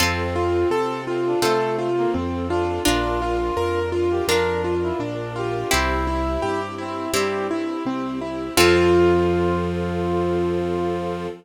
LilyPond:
<<
  \new Staff \with { instrumentName = "Acoustic Grand Piano" } { \time 4/4 \key f \major \tempo 4 = 84 c'8 f'8 a'8 f'8 a'8 f'8 c'8 f'8 | d'8 f'8 bes'8 f'8 bes'8 f'8 d'8 f'8 | c'8 e'8 g'8 e'8 g'8 e'8 c'8 e'8 | f'1 | }
  \new Staff \with { instrumentName = "Brass Section" } { \time 4/4 \key f \major c'4. c'16 d'16 a8. bes16 r8 d'8 | f'4. f'16 g'16 d'8. e'16 r8 g'8 | e'4. c'8 g8 r4. | f1 | }
  \new Staff \with { instrumentName = "Orchestral Harp" } { \time 4/4 \key f \major <c' f' a'>2 <c' f' a'>2 | <d' f' bes'>2 <d' f' bes'>2 | <c' e' g'>2 <c' e' g'>2 | <c' f' a'>1 | }
  \new Staff \with { instrumentName = "Acoustic Grand Piano" } { \clef bass \time 4/4 \key f \major f,4 c4 c4 f,4 | bes,,4 f,4 f,4 bes,,4 | c,4 g,4 g,4 c,4 | f,1 | }
  \new Staff \with { instrumentName = "String Ensemble 1" } { \time 4/4 \key f \major <c' f' a'>1 | <d' f' bes'>1 | <c' e' g'>1 | <c' f' a'>1 | }
>>